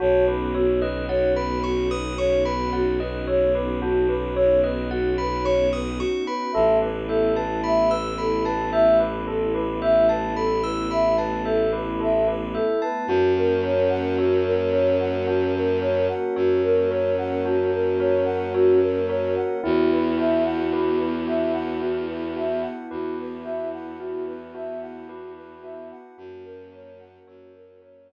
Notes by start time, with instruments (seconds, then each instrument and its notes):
0.00 violin B1, pad 2 (warm) B3 C#4 D#4 F#4, tubular bells F#4, ocarina C#5
0.27 tubular bells B4, ocarina B4
0.55 ocarina F#4, tubular bells C#5
0.80 ocarina B4, tubular bells D#5
1.08 ocarina C#5, tubular bells F#5
1.34 ocarina B4, tubular bells B5
1.64 ocarina F#4, tubular bells C#6
1.89 ocarina B4, tubular bells D#6
2.18 ocarina C#5, tubular bells C#6
2.45 ocarina B4, tubular bells B5
2.73 ocarina F#4, tubular bells F#5
3.00 ocarina B4, tubular bells D#5
3.27 tubular bells C#5, ocarina C#5
3.54 ocarina B4, tubular bells B4
3.82 tubular bells F#4, ocarina F#4
4.09 ocarina B4, tubular bells B4
4.35 ocarina C#5, tubular bells C#5
4.64 ocarina B4, tubular bells D#5
4.90 ocarina F#4, tubular bells F#5
5.18 ocarina B4, tubular bells B5
5.44 ocarina C#5, tubular bells C#6
5.73 ocarina B4, tubular bells D#6
5.98 ocarina F#4, tubular bells C#6
6.27 ocarina B4, tubular bells B5
6.52 violin A1, pad 2 (warm) A3 B3 E4, tubular bells A4, ocarina E5
6.82 ocarina B4, tubular bells B4
7.08 ocarina A4, tubular bells E5
7.35 ocarina B4, tubular bells A5
7.64 ocarina E5, tubular bells B5
7.89 ocarina B4, tubular bells E6
8.18 ocarina A4, tubular bells B5
8.45 ocarina B4, tubular bells A5
8.73 tubular bells E5, ocarina E5
8.98 ocarina B4, tubular bells B4
9.27 tubular bells A4, ocarina A4
9.54 ocarina B4, tubular bells B4
9.82 tubular bells E5, ocarina E5
10.09 ocarina B4, tubular bells A5
10.36 ocarina A4, tubular bells B5
10.64 ocarina B4, tubular bells E6
10.91 ocarina E5, tubular bells B5
11.17 ocarina B4, tubular bells A5
11.45 ocarina A4, tubular bells E5
11.73 tubular bells B4, ocarina B4
12.00 tubular bells A4, ocarina E5
12.27 tubular bells B4, ocarina B4
12.54 ocarina A4, tubular bells E5
12.82 ocarina B4, tubular bells A5
13.07 violin F#2, pad 2 (warm) A#3 C#4 F#4, ocarina F#4, tubular bells F#4
13.36 ocarina A#4
13.63 tubular bells A#4, ocarina C#5
13.89 ocarina F#5
14.18 ocarina F#4, tubular bells C#5
14.45 ocarina A#4
14.71 tubular bells A#4, ocarina C#5
15.00 ocarina F#5
15.27 ocarina F#4, tubular bells F#4
15.55 ocarina A#4
15.81 tubular bells A#4, ocarina C#5
16.09 ocarina F#5
16.36 violin F#2, ocarina F#4, tubular bells C#5
16.64 ocarina A#4
16.91 tubular bells A#4, ocarina C#5
17.18 ocarina F#5
17.45 ocarina F#4, tubular bells F#4
17.73 ocarina A#4
17.99 tubular bells A#4, ocarina C#5
18.25 ocarina F#5
18.53 ocarina F#4, tubular bells C#5
18.80 ocarina A#4
19.08 tubular bells A#4, ocarina C#5
19.36 ocarina F#5
19.62 violin E2, pad 2 (warm) B3 E4 F#4, tubular bells E4, ocarina F#4
19.92 ocarina B4
20.18 tubular bells F#4, ocarina E5
20.45 ocarina F#5
20.73 ocarina F#4, tubular bells B4
20.98 ocarina B4
21.27 tubular bells F#4, ocarina E5
21.53 ocarina F#5
21.81 tubular bells E4, ocarina F#4
22.07 ocarina B4
22.36 tubular bells F#4, ocarina E5
22.62 ocarina F#5
22.91 violin E2, ocarina F#4, tubular bells B4
23.20 ocarina B4
23.44 tubular bells F#4, ocarina E5
23.73 ocarina F#5
23.98 tubular bells E4, ocarina F#4
24.27 ocarina B4
24.55 tubular bells F#4, ocarina E5
24.81 ocarina F#5
25.07 ocarina F#4, tubular bells B4
25.36 ocarina B4
25.62 tubular bells F#4, ocarina E5
25.91 ocarina F#5
26.18 violin F#2, pad 2 (warm) A#3 C#4 F#4, tubular bells F#4, ocarina F#4
26.44 ocarina A#4
26.73 tubular bells A#4, ocarina C#5
26.99 ocarina F#5
27.27 violin F#2, ocarina F#4, tubular bells C#5
27.55 ocarina A#4
27.82 tubular bells A#4, ocarina C#5
28.08 ocarina F#5